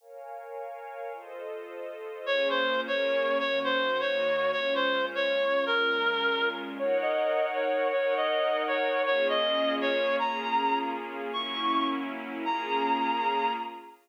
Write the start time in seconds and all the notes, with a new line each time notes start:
0.00 A#4 C#5 F5 G#5
1.13 F4 A4 C5 D#5
2.26 A#3 C#4 F4 G#4 C#5
2.50 C5
2.87 A#3 C#4 G#4 A#4 C#5
3.39 D#3 A#3 C#4 F#4 C#5
3.64 C5
4.00 D#3 A#3 D#4 F#4 C#5
4.52 A#2 G#3 C#4 F4 C#5
4.75 C5
5.15 C#5
5.66 A#2 G#3 C#4 F4 A#4
6.79 D#4 A#4 C#5 F#5
7.02 D#5
7.54 C#5
7.92 D#4 A#4 C#5 F#5
8.17 D#5
8.68 C#5
9.06 A#3 C#4 F4 G#4 C#5
9.29 D#5
9.81 C#5
10.19 A#3 C#4 F4 G#4 A#5
11.32 F#3 A#3 C#4 E4 C#6
12.45 A#3 C#4 F4 G#4 A#5